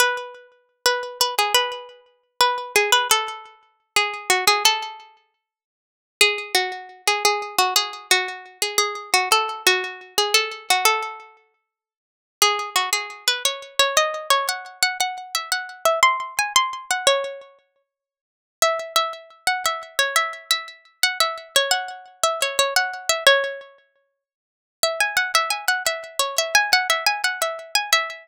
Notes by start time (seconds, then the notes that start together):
0.00 B4
0.86 B4
1.21 B4
1.39 G#4
1.54 B4
2.41 B4
2.76 G#4
2.92 B4
3.11 A4
3.96 G#4
4.30 F#4
4.47 G#4
4.65 A4
6.21 G#4
6.55 F#4
7.07 G#4
7.25 G#4
7.58 F#4
7.76 G#4
8.11 F#4
8.62 G#4
8.78 G#4
9.14 F#4
9.32 A4
9.67 F#4
10.18 G#4
10.34 A4
10.70 F#4
10.85 A4
12.42 G#4
12.76 F#4
12.93 G#4
13.28 B4
13.45 C#5
13.79 C#5
13.97 D#5
14.30 C#5
14.49 F#5
14.83 F#5
15.00 F#5
15.35 E5
15.52 F#5
15.85 E5
16.03 C6
16.39 G#5
16.56 C6
16.91 F#5
17.07 C#5
18.62 E5
18.96 E5
19.47 F#5
19.66 E5
19.99 C#5
20.16 E5
20.51 E5
21.03 F#5
21.20 E5
21.56 C#5
21.71 F#5
22.23 E5
22.42 C#5
22.59 C#5
22.76 F#5
23.09 E5
23.27 C#5
24.83 E5
25.00 G#5
25.17 F#5
25.35 E5
25.50 G#5
25.68 F#5
25.86 E5
26.19 C#5
26.38 E5
26.55 G#5
26.73 F#5
26.90 E5
27.06 G#5
27.24 F#5
27.42 E5
27.75 G#5
27.93 E5